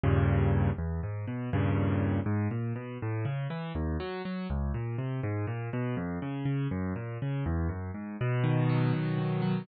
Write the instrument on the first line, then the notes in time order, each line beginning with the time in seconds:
acoustic grand piano
0.03 D#2 G2 A#2 C#3
0.78 E2
1.03 G#2
1.28 B2
1.53 D#2 G2 A#2 C#3
2.26 G#2
2.51 A#2
2.76 B2
3.02 A2
3.25 C#3
3.50 E3
3.75 D#2
4.00 F#3
4.25 F#3
4.50 C#2
4.74 A#2
4.98 C3
5.23 G#2
5.47 A#2
5.73 B2
5.97 F2
6.22 C#3
6.45 C#3
6.71 F#2
6.96 A#2
7.22 C#3
7.46 E2
7.69 F#2
7.94 G#2
8.21 B2
8.44 D#3
8.70 F#3
8.93 B2
9.18 D#3
9.42 F#3